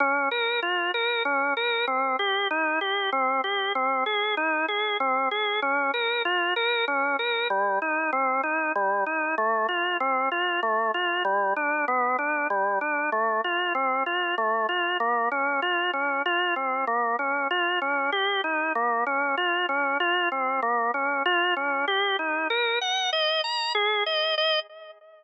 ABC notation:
X:1
M:3/4
L:1/8
Q:1/4=96
K:Bbdor
V:1 name="Drawbar Organ"
D B F B D B | C G E G C G | C A E A C A | D B F B D B |
[K:Cdor] G, E C E G, E | A, F C F A, F | G, D =B, D G, D | A, F C F A, F |
[K:Bbdor] B, D F D F C | B, D F D G E | B, D F D F C | B, D F D G E |
[K:Ebdor] B g e b A e | e2 z4 |]